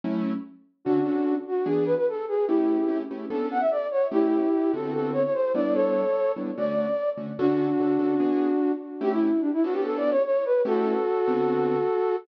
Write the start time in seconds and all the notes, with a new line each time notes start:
0.04 F#3 A3 C#4 E4
0.85 D3 C#4 D4 F#4 A4
1.05 D3 C#4 F#4 A4
1.47 F#4
1.66 E3 B3 D4 G#4
1.85 B4
1.96 B4
2.08 A4
2.28 G#4
2.47 A3 C#4 E4 G4
2.88 A3 C#4 E4 G4
3.11 A3 C#4 E4 G4
3.30 B3 C#4 D4 A4
3.51 F#5
3.60 E5
3.71 D5
3.91 C#5
4.11 A3 C#4 E4 G4
4.73 D3 B3 C4 F#4 A4
4.94 A4
5.13 C#5
5.24 C#5
5.33 C5
5.54 G3 B3 D4 E4 D5
5.74 A4 C#5
6.36 G3 B3 D4 E4
6.57 D3 A3 C#4 F#4 D5
7.17 D3 A3 C#4 F#4
7.38 D3 C#4 D4 F#4 A4
7.80 D3 C#4 F#4 A4
7.99 D3 C#4 F#4 A4
8.20 E3 B3 D4 G#4
9.01 A3 C#4 E4 G4
9.13 E4
9.40 D4
9.53 E4
9.64 B3 C#4 D4 F#4 A4
9.73 G4
9.84 A4
9.97 D5
10.10 C#5
10.24 C#5
10.45 B4
10.65 A3 C#4 E4 F#4 G4 A4
11.27 D3 B3 C4 F#4